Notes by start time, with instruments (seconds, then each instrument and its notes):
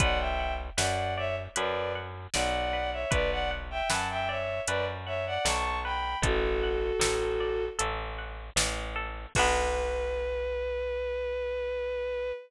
0.00 electric bass (finger) B1, orchestral harp B4, violin D5 F#5, kick, closed hi-hat
0.19 violin E5 G5
0.39 orchestral harp F#5
0.77 electric bass (finger) F#2, orchestral harp B4, violin D5 F#5, snare
1.17 violin C#5 E5, orchestral harp D5
1.56 electric bass (finger) F#2, orchestral harp B4, violin B4 D5, closed hi-hat
1.95 orchestral harp F#5
2.34 electric bass (finger) B1, violin D5 F#5, orchestral harp D5, snare
2.73 orchestral harp B4
2.92 violin C#5 E5
3.11 electric bass (finger) B1, orchestral harp B4, violin B4 D5, kick, closed hi-hat
3.31 violin D5 F#5
3.51 orchestral harp F#5
3.71 violin E5 G5
3.89 electric bass (finger) F#2, orchestral harp B4, violin F#5 A5, snare
4.10 violin E5 G5
4.28 violin C#5 E5, orchestral harp D5
4.67 electric bass (finger) F#2, violin B4 D5, orchestral harp B4, closed hi-hat
5.06 violin C#5 E5, orchestral harp F#5
5.26 violin D5 F#5
5.45 electric bass (finger) B1, orchestral harp D5, violin A5 C#6, snare
5.84 orchestral harp B4, violin G5 B5
6.22 electric bass (finger) A1, violin F#4 A4, orchestral harp A4, kick, closed hi-hat
6.63 orchestral harp F#5
7.00 electric bass (finger) A1, orchestral harp A4, snare
7.40 orchestral harp D5
7.79 electric bass (finger) A1, orchestral harp A4, closed hi-hat
8.18 orchestral harp F#5
8.56 electric bass (finger) A1, orchestral harp D5, snare
8.96 orchestral harp A4
9.35 electric bass (finger) B1, orchestral harp D4 F#4, violin B4, kick, crash
9.39 orchestral harp B3